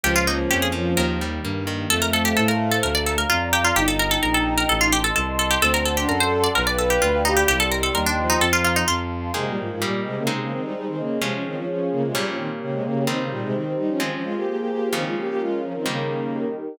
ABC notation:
X:1
M:4/4
L:1/16
Q:1/4=129
K:Ab
V:1 name="Harpsichord"
G F E z G A z2 B6 z2 | [K:Bb] A B A G A B2 A B d A B F2 G F | G A B A B A2 B A F G A A2 A G | A B A G B c2 d B d A G F2 E G |
G A B A B D2 E A F F E F4 | [K:Ab] z16 | z16 | z16 |
z16 |]
V:2 name="Violin"
F,2 F,4 F,4 z6 | [K:Bb] A,12 z4 | E12 z4 | C3 D A4 =B2 B4 G2 |
G,6 F,6 z4 | [K:Ab] [C,A,] [B,,G,] [A,,F,] [A,,F,] [B,,G,]2 [C,A,] [D,B,] [C,A,] [D,B,] [E,C] [G,E] [G,E] [E,C] [D,B,]2 | [C,A,] [F,D] [E,C] [F,D] [F,D]2 [D,B,] [C,A,] [B,,G,] [F,D] [E,C] z [D,B,] [C,A,] [D,B,]2 | [E,C] [D,B,] [B,,G,] [C,A,] [E,C]2 [G,E] [F,D] [E,C] [F,D] [A,F] [B,G] [B,G] [B,G] [B,G]2 |
[E,C] [A,F] [B,G] [B,G] [A,F]2 [F,D] [E,C] [D,B,]6 z2 |]
V:3 name="Acoustic Guitar (steel)"
F,2 B,2 D2 F,2 E,2 G,2 B,2 E,2 | [K:Bb] z16 | z16 | z16 |
z16 | [K:Ab] [E,B,A]4 [G,B,E]4 [A,CE]8 | [F,A,D]8 [B,,G,D]8 | [E,G,C]8 [F,A,C]8 |
[D,F,B,]8 [E,G,B,]8 |]
V:4 name="Violin" clef=bass
D,,4 F,,4 E,,4 G,,4 | [K:Bb] F,,4 A,,4 D,,4 F,,4 | G,,,4 B,,,4 A,,,4 C,,4 | D,,4 ^F,,4 =B,,,4 D,,4 |
C,,4 E,,4 F,,4 F,,4 | [K:Ab] z16 | z16 | z16 |
z16 |]
V:5 name="Pad 2 (warm)"
[F,B,D]8 [E,G,B,]8 | [K:Bb] [cfa]8 [dfb]8 | [egb]8 [eac']8 | [d^fac']8 [d=fg=b]8 |
[egc']8 [fbc']4 [fac']4 | [K:Ab] [EBa]4 [GBe]4 [Ace]8 | [FAd]8 [B,Gd]8 | [EGc]8 [FAc]8 |
[DFB]8 [EGB]8 |]